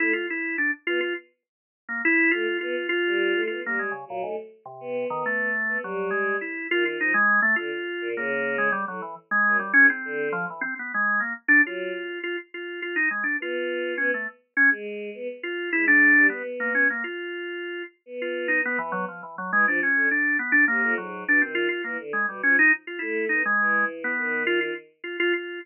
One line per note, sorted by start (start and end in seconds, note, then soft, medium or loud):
0.00 0.13 A3 medium
0.00 0.12 E4 loud
0.13 0.26 F4 medium
0.30 0.56 E4 medium
0.58 0.71 D4 medium
0.87 1.00 B3 medium
0.87 1.00 F4 loud
1.00 1.14 F4 medium
1.89 2.02 A#3 medium
2.05 2.31 E4 loud
2.31 2.46 A3 medium
2.31 2.58 F4 medium
2.61 2.75 B3 loud
2.61 2.87 F4 medium
2.89 3.42 F4 loud
3.05 3.32 G3 medium
3.35 3.48 A3 loud
3.47 3.62 B3 medium
3.47 3.60 F4 medium
3.64 3.90 G3 medium
3.64 3.79 A#3 medium
3.79 3.92 G#3 medium
3.91 4.04 C#3 medium
4.08 4.23 A#2 medium
4.08 4.21 F#3 medium
4.22 4.36 G#2 medium
4.22 4.36 A3 medium
4.66 5.05 C3 medium
4.80 5.07 B3 loud
5.10 5.23 D#3 loud
5.10 5.49 B3 medium
5.26 5.78 A3 medium
5.68 5.81 B3 medium
5.82 6.10 F#3 medium
5.82 6.35 G3 medium
6.11 6.37 G#3 medium
6.41 6.67 E4 soft
6.70 6.96 D#3 medium
6.70 6.84 F4 loud
6.86 6.99 F4 medium
6.99 7.12 F3 medium
6.99 7.14 D#4 medium
7.14 7.40 G#3 loud
7.42 7.55 A3 loud
7.56 7.70 D3 medium
7.56 8.08 F4 medium
8.01 8.14 A#2 loud
8.16 8.68 C#3 loud
8.16 8.56 A#3 medium
8.58 8.71 G#3 medium
8.72 8.85 G3 loud
8.88 9.01 A2 soft
8.88 9.01 F#3 medium
9.02 9.15 E3 medium
9.31 9.57 G#3 loud
9.46 9.60 F#2 medium
9.59 9.73 G3 medium
9.73 9.89 G#2 medium
9.73 9.87 C#4 loud
9.90 10.29 C4 medium
10.05 10.31 D3 medium
10.32 10.46 F3 loud
10.50 10.63 E3 medium
10.61 10.74 C4 loud
10.79 10.92 B3 medium
10.94 11.21 G#3 medium
11.20 11.33 A#3 medium
11.48 11.62 D4 loud
11.65 11.91 F#3 medium
11.65 12.19 F4 medium
12.23 12.37 F4 medium
12.54 12.80 F4 medium
12.82 12.95 F4 medium
12.96 13.09 D#4 medium
13.11 13.24 G#3 medium
13.23 13.37 D4 medium
13.40 13.92 B3 medium
13.40 13.95 F4 medium
13.98 14.11 B3 loud
13.98 14.11 C#4 medium
14.14 14.27 A3 medium
14.57 14.70 C#4 loud
14.71 15.10 G#3 loud
15.14 15.28 B3 loud
15.43 15.70 F4 medium
15.73 16.12 G#3 medium
15.73 15.86 E4 loud
15.88 16.27 D4 loud
16.16 16.29 G3 medium
16.29 16.42 B3 medium
16.29 16.84 B3 medium
16.60 16.73 A#3 medium
16.75 16.88 C#4 medium
16.90 17.03 A#3 medium
17.04 17.83 F4 medium
18.06 18.58 B3 medium
18.22 18.48 F4 medium
18.48 18.61 D#4 medium
18.64 18.77 B3 medium
18.64 18.79 B3 medium
18.79 18.92 E3 loud
18.79 19.05 B3 medium
18.92 19.05 F#3 loud
19.08 19.21 F3 medium
19.23 19.36 E3 medium
19.38 19.51 F#3 medium
19.52 19.65 E3 medium
19.52 19.66 G#3 loud
19.66 19.79 F3 loud
19.66 19.81 D4 medium
19.83 20.09 C#4 medium
19.95 20.08 D3 medium
20.11 20.37 D4 medium
20.39 20.52 B3 medium
20.52 20.65 D4 loud
20.68 20.81 C3 medium
20.68 20.94 A#3 medium
20.83 20.96 F2 medium
20.97 21.24 G#2 medium
20.97 21.24 F#3 medium
21.27 21.40 B2 medium
21.27 21.42 D4 medium
21.41 21.67 D#3 medium
21.41 21.55 C4 medium
21.55 21.68 F4 loud
21.69 21.82 F4 medium
21.84 21.97 E3 medium
21.84 21.97 A#3 medium
21.99 22.12 D3 medium
22.13 22.26 G#3 medium
22.28 22.41 B2 medium
22.28 22.42 G3 medium
22.43 22.56 F3 medium
22.43 22.56 C#4 medium
22.59 22.72 D#4 loud
22.87 23.00 F4 medium
22.99 23.27 A3 medium
22.99 23.25 E4 medium
23.29 23.43 B3 medium
23.29 23.42 D#4 medium
23.46 23.85 G#3 medium
23.59 24.12 E3 medium
24.04 24.43 B3 medium
24.18 24.70 D#3 medium
24.47 24.60 F4 loud
24.61 24.74 F4 medium
25.04 25.17 F4 medium
25.20 25.33 F4 loud
25.33 25.59 F4 soft